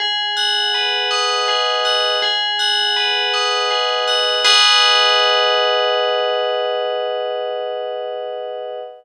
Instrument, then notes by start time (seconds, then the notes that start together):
tubular bells
0.00 G#4
0.37 F#5
0.74 B4
1.11 D#5
1.48 G#4
1.85 F#5
2.22 G#4
2.59 F#5
2.96 B4
3.33 D#5
3.71 G#4
4.08 F#5
4.44 G#4 B4 D#5 F#5